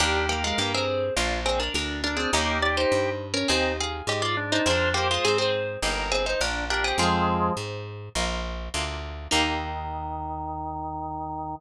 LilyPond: <<
  \new Staff \with { instrumentName = "Harpsichord" } { \time 4/4 \key ees \major \tempo 4 = 103 <d' bes'>8 <bes g'>16 <aes f'>16 <bes g'>16 <c' aes'>8. r8 <c' aes'>16 <d' bes'>16 <d' bes'>8 <d' bes'>16 <c' aes'>16 | <bes g'>8 d''16 <ees' c''>4 <des' bes'>16 <c' aes'>8 <aes' f''>8 <g' ees''>16 <f' d''>16 r16 <ees' c''>16 | <d' bes'>8 <bes g'>16 <aes f'>16 <c' aes'>16 <c' aes'>8. r8 <c' aes'>16 <ees' c''>16 <d' bes'>8 <d' bes'>16 <c' aes'>16 | <c' aes'>2 r2 |
ees'1 | }
  \new Staff \with { instrumentName = "Drawbar Organ" } { \time 4/4 \key ees \major g'8 bes'4 r8 f'8 r4 d'8 | ees'8 g'4 r8 ees'8 r4 d'8 | c''8 c''4 r8 bes'8 r4 g'8 | <f aes>4 r2. |
ees1 | }
  \new Staff \with { instrumentName = "Acoustic Guitar (steel)" } { \time 4/4 \key ees \major <bes ees' g'>2 <bes d' f'>2 | <bes des' ees' g'>2 <c' ees' aes'>2 | <c' f' aes'>2 <bes ees' g'>2 | <c' f' aes'>2 <bes ees' f'>4 <bes d' f'>4 |
<bes ees' g'>1 | }
  \new Staff \with { instrumentName = "Electric Bass (finger)" } { \clef bass \time 4/4 \key ees \major ees,4 g,4 bes,,4 d,4 | ees,4 g,4 ees,4 aes,4 | f,4 aes,4 g,,4 bes,,4 | f,4 aes,4 bes,,4 d,4 |
ees,1 | }
>>